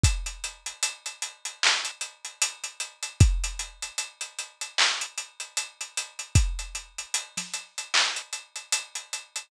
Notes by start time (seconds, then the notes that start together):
0.03 kick, closed hi-hat
0.26 closed hi-hat
0.44 closed hi-hat
0.66 closed hi-hat
0.83 closed hi-hat
1.06 closed hi-hat
1.22 closed hi-hat
1.45 closed hi-hat
1.63 clap
1.85 closed hi-hat
2.01 closed hi-hat
2.25 closed hi-hat
2.42 closed hi-hat
2.64 closed hi-hat
2.80 closed hi-hat
3.03 closed hi-hat
3.20 kick, closed hi-hat
3.44 closed hi-hat
3.59 closed hi-hat
3.82 closed hi-hat
3.98 closed hi-hat
4.21 closed hi-hat
4.39 closed hi-hat
4.61 closed hi-hat
4.78 clap
5.01 closed hi-hat
5.18 closed hi-hat
5.40 closed hi-hat
5.57 closed hi-hat
5.81 closed hi-hat
5.97 closed hi-hat
6.19 closed hi-hat
6.35 kick, closed hi-hat
6.59 closed hi-hat
6.75 closed hi-hat
6.98 closed hi-hat
7.14 closed hi-hat
7.37 snare, closed hi-hat
7.54 closed hi-hat
7.78 closed hi-hat
7.94 clap
8.16 closed hi-hat
8.33 closed hi-hat
8.56 closed hi-hat
8.72 closed hi-hat
8.95 closed hi-hat
9.13 closed hi-hat
9.36 closed hi-hat